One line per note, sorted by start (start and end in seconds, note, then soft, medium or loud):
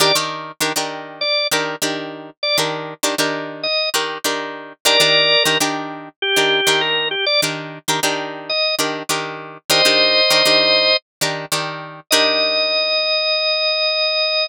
0.00 0.12 D#3 medium
0.00 0.12 D4 medium
0.00 0.12 G4 loud
0.00 0.12 A#4 loud
0.00 0.15 D5 loud
0.15 0.52 D#3 medium
0.15 0.52 D4 medium
0.15 0.52 G4 medium
0.15 0.52 A#4 medium
0.60 0.73 D#3 medium
0.60 0.73 D4 medium
0.60 0.73 G4 medium
0.60 0.73 A#4 medium
0.76 1.24 D#3 medium
0.76 1.24 D4 medium
0.76 1.24 G4 medium
0.76 1.24 A#4 medium
1.21 1.47 D5 loud
1.51 1.76 D#3 medium
1.51 1.76 D4 medium
1.51 1.76 G4 medium
1.51 1.76 A#4 medium
1.82 2.30 D#3 medium
1.82 2.30 D4 medium
1.82 2.30 G4 medium
1.82 2.30 A#4 medium
2.43 2.57 D5 loud
2.58 2.94 D#3 medium
2.58 2.94 D4 medium
2.58 2.94 G4 medium
2.58 2.94 A#4 medium
3.03 3.15 D#3 medium
3.03 3.15 D4 medium
3.03 3.15 G4 medium
3.03 3.15 A#4 medium
3.18 3.67 D#3 medium
3.18 3.67 D4 medium
3.18 3.67 G4 medium
3.18 3.67 A#4 medium
3.63 3.89 D#5 medium
3.94 4.18 D#3 medium
3.94 4.18 D4 medium
3.94 4.18 G4 medium
3.94 4.18 A#4 medium
4.24 4.73 D#3 medium
4.24 4.73 D4 medium
4.24 4.73 G4 medium
4.24 4.73 A#4 medium
4.85 4.97 D#3 medium
4.85 4.97 D4 medium
4.85 4.97 G4 loud
4.85 5.43 A#4 loud
4.85 4.97 A#4 loud
4.85 5.43 D5 loud
5.00 5.36 D#3 medium
5.00 5.36 D4 medium
5.00 5.36 G4 medium
5.00 5.36 A#4 medium
5.44 5.58 D#3 medium
5.44 5.58 D4 medium
5.44 5.58 G4 medium
5.44 5.58 A#4 medium
5.60 6.09 D#3 medium
5.60 6.09 D4 medium
5.60 6.09 G4 medium
5.60 6.09 A#4 medium
6.22 6.81 G4 loud
6.36 6.61 D#3 medium
6.36 6.61 D4 medium
6.36 6.61 G4 medium
6.36 6.61 A#4 medium
6.67 7.15 D#3 medium
6.67 7.15 D4 medium
6.67 7.15 G4 medium
6.67 7.15 A#4 medium
6.81 7.08 A#4 medium
7.11 7.25 G4 medium
7.26 7.41 D5 loud
7.42 7.79 D#3 medium
7.42 7.79 D4 medium
7.42 7.79 G4 medium
7.42 7.79 A#4 medium
7.88 8.00 D#3 medium
7.88 8.00 D4 medium
7.88 8.00 G4 medium
7.88 8.00 A#4 medium
8.03 8.51 D#3 medium
8.03 8.51 D4 medium
8.03 8.51 G4 medium
8.03 8.51 A#4 medium
8.49 8.75 D#5 loud
8.79 9.03 D#3 medium
8.79 9.03 D4 medium
8.79 9.03 G4 medium
8.79 9.03 A#4 medium
9.09 9.58 D#3 medium
9.09 9.58 D4 medium
9.09 9.58 G4 medium
9.09 9.58 A#4 medium
9.70 9.82 D#3 loud
9.70 9.82 D4 medium
9.70 9.82 G4 medium
9.70 9.82 A#4 medium
9.70 10.97 C5 loud
9.70 10.97 D#5 loud
9.85 10.21 D#3 medium
9.85 10.21 D4 medium
9.85 10.21 G4 medium
9.85 10.21 A#4 medium
10.30 10.42 D#3 medium
10.30 10.42 D4 medium
10.30 10.42 G4 medium
10.30 10.42 A#4 medium
10.45 10.94 D#3 medium
10.45 10.94 D4 medium
10.45 10.94 G4 medium
10.45 10.94 A#4 medium
11.21 11.45 D#3 medium
11.21 11.45 D4 medium
11.21 11.45 G4 medium
11.21 11.45 A#4 medium
11.52 12.00 D#3 medium
11.52 12.00 D4 medium
11.52 12.00 G4 medium
11.52 12.00 A#4 medium
12.11 14.48 D#3 loud
12.11 14.48 D4 loud
12.11 14.48 G4 loud
12.11 14.48 A#4 loud
12.11 14.46 D#5 loud